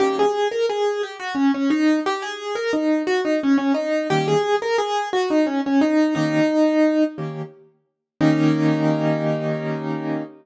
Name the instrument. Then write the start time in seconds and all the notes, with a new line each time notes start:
acoustic grand piano
0.00 D#3 G3 A#3 C#4 G4
0.19 G#4
0.51 A#4
0.69 G#4
1.03 G4
1.20 F#4
1.35 C#4
1.54 C#4
1.70 D#4
2.06 G4
2.22 G#4
2.55 A#4
2.73 D#4
3.07 F#4
3.25 D#4
3.43 C#4
3.58 C#4
3.74 D#4
4.10 D#3 G3 A#3 C#4 G4
4.28 G#4
4.62 A#4
4.78 G#4
5.13 F#4
5.30 D#4
5.47 C#4
5.66 C#4
5.81 D#4
6.15 D#3 A#3 C#4 D#4 G4
7.18 D#3 A#3 C#4 G4
8.21 D#3 A#3 C#4 D#4 G4